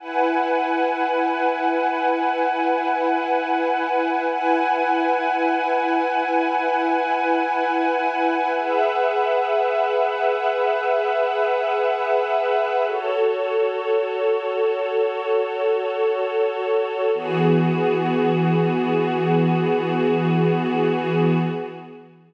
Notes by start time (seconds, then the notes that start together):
0.00 E4 B4 F#5 G#5
4.28 E4 B4 F#5 G#5
8.57 G#4 B4 E5 F#5
12.86 F#4 A4 C#5
17.14 E3 B3 F#4 G#4